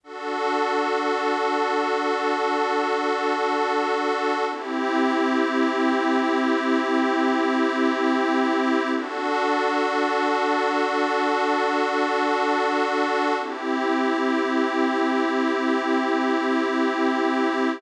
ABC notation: X:1
M:4/4
L:1/8
Q:1/4=54
K:Dmix
V:1 name="Pad 5 (bowed)"
[DFA]8 | [CEG]8 | [DFA]8 | [CEG]8 |]